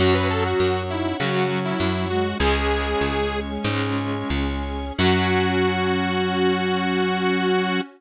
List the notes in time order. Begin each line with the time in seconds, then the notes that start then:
0.00 F#2 F#3 C#4 F#4 C#5 F#5
0.14 B4
0.30 A4
0.46 F#4
0.60 F#2
0.90 D#4 E4
1.19 C#3 F#3 C#4 F#4
1.50 F#3
1.65 E4
1.80 F#2 F#3
2.10 G#3 F#4
2.39 C#2 G#3 C#4 G#4 C#5 G#5
3.01 C#2
3.64 G#2 G#3 C#4
4.30 C#2
4.98 F#2 F#3 C#4 F#4